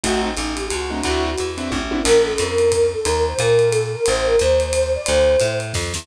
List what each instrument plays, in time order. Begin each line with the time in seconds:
0.03 electric bass (finger) A1, acoustic grand piano A3 C4 D#4 F#4, flute F#4, kick, ride
0.25 flute D#4
0.37 electric bass (finger) A1, hi-hat pedal, ride
0.55 flute G4, ride
0.70 electric bass (finger) C#2, flute F#4, ride
0.90 acoustic grand piano A3 C4 D#4 F#4, flute D4
1.03 electric bass (finger) D2, acoustic grand piano C4 D4 E4 F#4, flute F#4, kick, ride
1.38 electric bass (finger) E2, hi-hat pedal, ride
1.58 acoustic grand piano C4 D4 E4 F#4, ride
1.71 electric bass (finger) A1, kick, high tom
1.91 acoustic grand piano C4 D4 E4 F#4, high tom
2.03 electric bass (finger) A#1, flute A#4, crash, ride
2.25 flute A4
2.38 electric bass (finger) F2, flute A#4, hi-hat pedal, ride
2.58 ride
2.70 flute A#4, kick, ride
2.93 flute A4
3.04 electric bass (finger) D#2, flute A#4, ride
3.27 flute C5
3.38 electric bass (finger) A#2, flute A#4, kick, hi-hat pedal, ride
3.59 ride
3.70 flute A4, ride
3.92 flute A#4
4.06 electric bass (finger) A1, flute C5, ride
4.24 flute A#4
4.39 electric bass (finger) D#2, flute C5, hi-hat pedal, ride
4.60 ride
4.73 flute C5, ride
4.95 flute D5
5.04 flute C5, ride
5.08 electric bass (finger) D2
5.40 electric bass (finger) A2, hi-hat pedal, ride
5.60 ride
5.74 electric bass (finger) F2, kick, snare
5.94 electric bass (finger) E2, snare